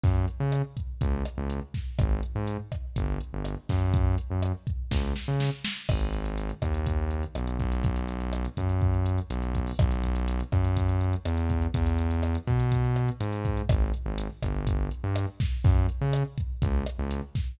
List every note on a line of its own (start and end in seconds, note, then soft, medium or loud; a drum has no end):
0.03 0.26 F#2 medium
0.03 kick loud
0.03 snare soft
0.28 closed hi-hat medium
0.40 0.62 C#3 medium
0.52 cross-stick medium
0.52 closed hi-hat loud
0.77 kick medium
0.77 closed hi-hat medium
1.01 1.23 C#2 medium
1.01 kick loud
1.01 closed hi-hat loud
1.25 cross-stick medium
1.25 closed hi-hat medium
1.38 1.60 C#2 medium
1.50 closed hi-hat loud
1.74 kick medium
1.74 snare medium
1.74 closed hi-hat medium
1.99 2.21 G#1 medium
1.99 kick loud
1.99 cross-stick loud
1.99 closed hi-hat loud
2.23 closed hi-hat medium
2.35 2.57 G#2 medium
2.47 closed hi-hat loud
2.72 kick medium
2.72 cross-stick medium
2.72 closed hi-hat medium
2.96 3.18 G1 medium
2.96 kick medium
2.96 closed hi-hat loud
3.21 closed hi-hat medium
3.33 3.55 G1 medium
3.45 cross-stick medium
3.45 closed hi-hat loud
3.69 4.16 F#2 medium
3.69 kick medium
3.69 snare medium
3.69 closed hi-hat medium
3.94 kick loud
3.94 closed hi-hat loud
4.18 closed hi-hat medium
4.30 4.52 F#2 medium
4.42 cross-stick loud
4.42 closed hi-hat loud
4.67 kick medium
4.67 closed hi-hat medium
4.91 5.13 C#2 medium
4.91 kick loud
4.91 snare medium
5.16 snare medium
5.28 5.50 C#3 medium
5.40 snare loud
5.64 snare loud
5.89 6.51 G#1 loud
5.89 kick loud
5.89 cross-stick loud
5.89 crash loud
6.01 closed hi-hat medium
6.13 closed hi-hat medium
6.25 closed hi-hat medium
6.38 closed hi-hat loud
6.50 closed hi-hat medium
6.62 7.24 D#2 medium
6.62 kick medium
6.62 cross-stick loud
6.62 closed hi-hat medium
6.74 closed hi-hat medium
6.86 kick medium
6.86 closed hi-hat loud
7.11 closed hi-hat medium
7.23 closed hi-hat medium
7.35 7.58 B1 medium
7.35 cross-stick loud
7.35 closed hi-hat loud
7.47 closed hi-hat medium
7.59 8.46 B1 loud
7.59 kick medium
7.59 closed hi-hat medium
7.72 closed hi-hat medium
7.84 kick loud
7.84 closed hi-hat loud
7.96 closed hi-hat loud
8.08 closed hi-hat medium
8.21 closed hi-hat medium
8.33 cross-stick loud
8.33 closed hi-hat loud
8.45 closed hi-hat medium
8.57 9.19 F#2 medium
8.57 kick medium
8.57 closed hi-hat loud
8.69 closed hi-hat medium
8.82 kick loud
8.94 closed hi-hat medium
9.06 closed hi-hat loud
9.18 closed hi-hat medium
9.30 9.72 B1 medium
9.30 closed hi-hat loud
9.42 closed hi-hat medium
9.55 kick medium
9.55 closed hi-hat medium
9.67 open hi-hat medium
9.79 10.41 B1 loud
9.79 kick loud
9.79 cross-stick loud
9.79 closed hi-hat loud
9.91 closed hi-hat medium
10.03 kick medium
10.03 closed hi-hat medium
10.16 closed hi-hat medium
10.28 closed hi-hat loud
10.40 closed hi-hat medium
10.52 11.15 F#2 medium
10.52 kick loud
10.52 cross-stick medium
10.52 closed hi-hat medium
10.64 closed hi-hat medium
10.77 kick medium
10.77 closed hi-hat loud
10.89 closed hi-hat medium
11.01 closed hi-hat medium
11.13 closed hi-hat medium
11.25 11.67 E2 medium
11.25 cross-stick loud
11.25 closed hi-hat loud
11.38 closed hi-hat medium
11.50 kick medium
11.50 closed hi-hat medium
11.62 closed hi-hat medium
11.74 12.36 E2 medium
11.74 kick loud
11.74 closed hi-hat loud
11.86 closed hi-hat medium
11.99 closed hi-hat medium
12.11 closed hi-hat medium
12.23 cross-stick loud
12.23 closed hi-hat loud
12.35 closed hi-hat medium
12.47 13.10 B2 medium
12.47 kick medium
12.47 closed hi-hat medium
12.60 closed hi-hat medium
12.72 kick medium
12.72 closed hi-hat loud
12.84 closed hi-hat medium
12.96 cross-stick medium
12.96 closed hi-hat medium
13.08 closed hi-hat medium
13.20 13.62 G#2 medium
13.20 closed hi-hat loud
13.33 closed hi-hat medium
13.45 kick loud
13.45 closed hi-hat loud
13.57 closed hi-hat medium
13.69 13.91 G#1 medium
13.69 kick loud
13.69 cross-stick loud
13.69 closed hi-hat loud
13.94 closed hi-hat medium
14.06 14.28 G#1 medium
14.18 closed hi-hat loud
14.42 14.89 G1 medium
14.42 kick medium
14.42 cross-stick loud
14.42 closed hi-hat medium
14.67 kick loud
14.67 closed hi-hat loud
14.91 closed hi-hat medium
15.04 15.26 G2 medium
15.16 cross-stick loud
15.16 closed hi-hat loud
15.40 kick loud
15.40 snare medium
15.40 closed hi-hat medium
15.64 15.86 F#2 medium
15.64 kick loud
15.64 snare medium
15.89 closed hi-hat medium
16.01 16.23 C#3 medium
16.13 cross-stick loud
16.13 closed hi-hat loud
16.38 kick medium
16.38 closed hi-hat medium
16.62 16.84 C#2 medium
16.62 kick loud
16.62 closed hi-hat loud
16.86 cross-stick loud
16.86 closed hi-hat loud
16.99 17.21 C#2 medium
17.11 closed hi-hat loud
17.35 kick loud
17.35 snare medium
17.35 closed hi-hat loud